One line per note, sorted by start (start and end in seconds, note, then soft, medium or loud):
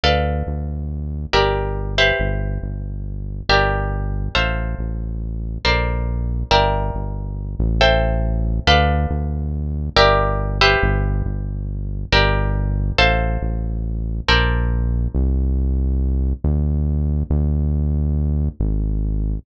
0.04 0.43 D2 medium
0.04 1.31 A4 medium
0.04 1.31 B4 medium
0.04 1.31 D5 medium
0.04 1.31 F5 medium
0.47 1.26 D2 medium
1.33 2.13 G1 medium
1.33 1.95 G4 medium
1.33 1.95 A#4 medium
1.33 1.95 D5 medium
1.33 1.95 E5 medium
1.98 3.47 G4 medium
1.98 3.47 B4 medium
1.98 3.47 C5 medium
1.98 3.47 E5 medium
2.20 2.59 G1 medium
2.63 3.42 G1 medium
3.49 4.29 G1 medium
3.49 4.34 G4 medium
3.49 4.34 A#4 medium
3.49 4.34 D5 medium
3.49 4.34 E5 medium
4.35 4.75 A1 medium
4.35 5.62 A4 medium
4.35 5.62 C5 medium
4.35 5.62 E5 medium
4.35 5.62 F5 medium
4.79 5.58 A1 medium
5.65 6.44 A#1 medium
5.65 6.49 A4 medium
5.65 6.49 A#4 medium
5.65 6.49 C5 medium
5.65 6.49 D5 medium
6.51 6.91 G1 loud
6.51 7.78 A#4 loud
6.51 7.78 D5 medium
6.51 7.78 E5 medium
6.51 7.78 G5 loud
6.95 7.56 G1 medium
7.59 8.60 A1 loud
7.81 8.65 A4 medium
7.81 8.65 C5 loud
7.81 8.65 E5 medium
7.81 8.65 G5 medium
8.67 9.07 D2 loud
8.67 9.94 A4 loud
8.67 9.94 B4 loud
8.67 9.94 D5 medium
8.67 9.94 F5 medium
9.10 9.90 D2 medium
9.96 10.76 G1 loud
9.96 10.58 G4 loud
9.96 10.58 A#4 loud
9.96 10.58 D5 medium
9.96 10.58 E5 loud
10.61 12.10 G4 loud
10.61 12.10 B4 loud
10.61 12.10 C5 medium
10.61 12.10 E5 loud
10.83 11.22 G1 loud
11.26 12.05 G1 medium
12.12 12.92 G1 loud
12.12 12.97 G4 medium
12.12 12.97 A#4 medium
12.12 12.97 D5 loud
12.12 12.97 E5 medium
12.98 13.38 A1 loud
12.98 14.25 A4 loud
12.98 14.25 C5 loud
12.98 14.25 E5 medium
12.98 14.25 F5 medium
13.42 14.21 A1 medium
14.28 15.08 A#1 loud
14.28 15.13 A4 medium
14.28 15.13 A#4 medium
14.28 15.13 C5 medium
14.28 15.13 D5 loud
15.15 16.34 C2 loud
16.44 17.24 D2 loud
17.30 18.49 D2 loud
18.60 19.39 G#1 loud